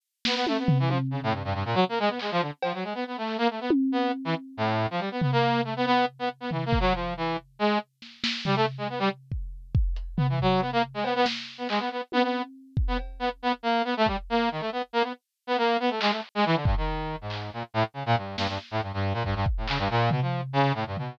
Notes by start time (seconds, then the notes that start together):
0.25 B3, snare
0.35 B3
0.47 A3, high tom
0.58 B3
0.68 floor tom
0.79 E3
0.88 F3, high tom
1.11 C#3
1.23 A2
1.33 G2
1.44 G2
1.54 G2
1.65 A#2
1.74 F#3
1.89 A#3
1.99 G#3
2.09 B3
2.19 G#3, clap
2.31 F3
2.41 D3
2.63 F3, cowbell
2.74 F#3
2.83 G#3
2.94 B3
3.07 B3
3.17 A3
3.27 clap
3.38 A#3
3.50 A3
3.61 B3
3.70 high tom
3.92 B3
4.25 E3
4.57 A2
4.90 F3
4.99 G3
5.11 B3
5.21 B3, floor tom
5.32 A#3
5.64 A3
5.76 B3
5.86 B3
6.19 B3
6.40 B3
6.51 E3, floor tom
6.65 A#3
6.73 kick
6.80 F#3
6.94 F3
7.17 E3
7.59 G#3
8.02 snare
8.24 snare
8.45 G3, floor tom
8.56 A3
8.78 G#3
8.89 B3
8.99 G3
9.32 kick
9.75 kick
9.96 closed hi-hat
10.17 B3, floor tom
10.29 E3
10.39 F#3, kick
10.61 B3
10.72 A#3
10.94 G#3
11.04 B3, cowbell
11.15 B3
11.26 snare
11.58 B3
11.69 G#3, clap
11.79 B3
11.91 B3
12.12 B3, high tom
12.22 B3
12.77 kick
12.88 B3
12.98 cowbell
13.19 B3
13.42 B3
13.63 A#3
13.84 B3
13.97 A3
14.06 G3, kick
14.29 A#3
14.51 D#3
14.60 A3
14.72 B3
14.93 A#3
15.03 B3
15.47 B3
15.58 A#3
15.80 B3
15.90 A3
16.01 G#3, clap
16.11 A3
16.35 G#3
16.45 E3
16.55 D3
16.65 G2, kick
16.77 D#3
17.21 G#2
17.30 clap
17.53 A#2
17.74 A2
17.94 C#3
18.06 A#2
18.17 G2
18.37 G2, snare
18.48 G2
18.71 A2
18.82 G2
18.93 G2
19.13 A#2
19.24 G2, kick
19.35 G2
19.46 kick
19.57 A2
19.68 C#3, clap
19.78 G2
19.90 A#2
20.11 B2, floor tom
20.22 F3
20.53 C#3
20.74 A2
20.87 G2
20.97 B2, floor tom